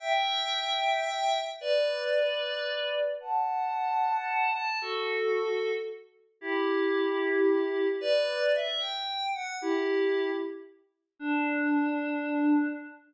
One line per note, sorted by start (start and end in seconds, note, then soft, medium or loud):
0.00 1.38 E5 medium
0.00 1.38 G5 medium
1.61 3.02 B4 medium
1.61 3.02 D5 medium
3.20 4.50 F#5 medium
3.20 4.50 A5 medium
4.53 4.78 A5 medium
4.81 5.72 F#4 medium
4.81 5.72 A4 medium
6.41 7.88 E4 medium
6.41 7.88 G4 medium
8.01 8.52 B4 medium
8.01 8.52 D5 medium
8.55 8.81 E5 medium
8.80 9.29 G5 medium
9.34 9.56 F#5 medium
9.61 10.30 E4 medium
9.61 10.30 G4 medium
11.19 12.68 D4 loud